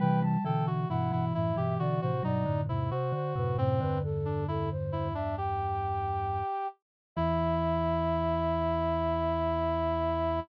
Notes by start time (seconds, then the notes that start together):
0.00 C3 E3 G3 B4 G5
0.22 G3 A5
0.44 B2 D3 E3 A4 G5
0.67 F#4
0.89 G2 B2 E3 E4 F#5
1.12 G2 B2 E3 E4
1.34 F#2 A2 E4 E5
1.56 G2 B2 E3 G4
1.79 B2 D3 F#4 D5
2.01 A2 C3 F#4 C5
2.23 G2 B2 F#3 D#4 D5
2.46 F#2 A2 D3
2.69 E2 G#2 C3 E4
2.91 C3 F#4 C5
3.12 D3 C5
3.36 F#2 A2 C3 B4
3.58 F#2 A2 C3 C4 C5
3.81 E2 G2 D3 B4
4.04 A4
4.25 D4
4.48 E4 A4
4.71 C5
4.92 E4
5.14 D4 E5
5.37 G4 G5
7.16 E2 E3 E4 E5